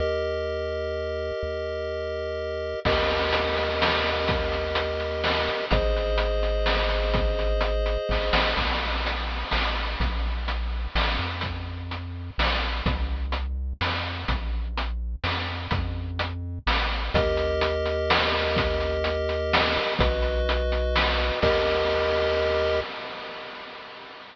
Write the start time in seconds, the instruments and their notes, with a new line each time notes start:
0.00 synth bass 1 D#2, lead 1 (square) G4 A#4 D#5
1.43 synth bass 1 D#2
2.85 synth bass 1 D#2, lead 1 (square) G4 A#4 D#5, kick, crash
3.10 closed hi-hat
3.33 closed hi-hat
3.56 closed hi-hat
3.82 snare
4.05 closed hi-hat
4.28 kick, closed hi-hat
4.52 closed hi-hat
4.75 closed hi-hat
5.00 closed hi-hat
5.24 snare
5.48 closed hi-hat
5.71 synth bass 1 G#1, lead 1 (square) G#4 C5 D#5, kick, closed hi-hat
5.97 closed hi-hat
6.18 closed hi-hat
6.43 closed hi-hat
6.66 snare
6.89 closed hi-hat
7.14 kick, closed hi-hat
7.39 closed hi-hat
7.61 closed hi-hat
7.86 closed hi-hat
8.09 synth bass 1 G#1, kick, snare
8.33 synth bass 1 A1, snare
8.57 synth bass 1 A#1, kick, crash
9.06 closed hi-hat
9.51 synth bass 1 A1, snare
10.00 synth bass 1 A#1, kick, closed hi-hat
10.48 closed hi-hat
10.95 synth bass 1 A1, snare
11.19 synth bass 1 F2
11.41 kick, closed hi-hat
11.91 closed hi-hat
12.38 synth bass 1 A#1, snare
12.86 synth bass 1 C2, kick, closed hi-hat
13.32 closed hi-hat
13.81 synth bass 1 F2, snare
14.28 synth bass 1 A#1, kick, closed hi-hat
14.77 closed hi-hat
15.24 synth bass 1 F2, snare
15.71 synth bass 1 F2, kick, closed hi-hat
16.19 closed hi-hat
16.67 synth bass 1 A1, snare
17.14 synth bass 1 D#2, lead 1 (square) G4 A#4 D#5, kick, closed hi-hat
17.37 closed hi-hat
17.61 closed hi-hat
17.86 closed hi-hat
18.10 snare
18.34 closed hi-hat
18.56 kick, closed hi-hat
18.80 closed hi-hat
19.04 closed hi-hat
19.29 closed hi-hat
19.53 snare
19.76 closed hi-hat
19.99 synth bass 1 B1, lead 1 (square) F#4 B4 D#5, kick, closed hi-hat
20.22 closed hi-hat
20.49 closed hi-hat
20.72 closed hi-hat
20.96 snare
21.19 closed hi-hat
21.42 synth bass 1 D#2, lead 1 (square) G4 A#4 D#5, kick, crash